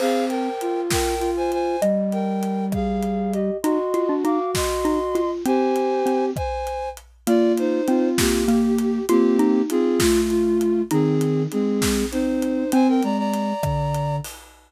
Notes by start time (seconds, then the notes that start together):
0.00 C4 G#4 C5 F5, crash
0.29 A#4 G5, closed hi-hat
0.61 F4, closed hi-hat
0.91 A#4 G5, kick, snare
1.19 F4, closed hi-hat
1.37 C5 G#5
1.52 C5 G#5, closed hi-hat
1.81 G3 D#5, closed hi-hat
2.12 A#4 G5, closed hi-hat
2.43 closed hi-hat
2.72 G#4 F5, kick, cross-stick
3.03 closed hi-hat
3.33 G4 D#5, closed hi-hat
3.63 D#4 F#4 D#5 C6, closed hi-hat
3.94 F4, closed hi-hat
4.09 D4
4.24 D#4 F5 D6, closed hi-hat
4.55 D#5 C6, kick, snare
4.85 D#4, closed hi-hat
5.15 F4, closed hi-hat
5.45 C4 G4 C5 G#5, closed hi-hat
5.76 closed hi-hat
6.06 C4, closed hi-hat
6.36 C5 G#5, kick, cross-stick
6.67 closed hi-hat
6.97 closed hi-hat
7.27 A#3 F4 D5, closed hi-hat
7.58 D#4 C5, closed hi-hat
7.88 C4 F4, closed hi-hat
8.18 A#3 G4, kick, snare
8.48 A#3 G4, closed hi-hat
8.79 closed hi-hat
9.09 A#3 C4 F4 G4, closed hi-hat
9.39 D#4, closed hi-hat
9.70 C4 F4 G#4, closed hi-hat
10.00 A3 F4, kick, snare
10.30 F4, closed hi-hat
10.61 closed hi-hat
10.91 D#3 C4 D#4 G#4, closed hi-hat
11.21 closed hi-hat
11.52 G#3 C4 G#4, closed hi-hat
11.82 kick, snare
12.12 C4 D#4 C5, closed hi-hat
12.42 closed hi-hat
12.72 C4 C5 G#5, closed hi-hat
12.88 A#4 G5
13.03 G#3 D5 A#5, closed hi-hat
13.18 D5 A#5
13.34 closed hi-hat
13.63 D3, kick, cross-stick
13.95 closed hi-hat
14.24 open hi-hat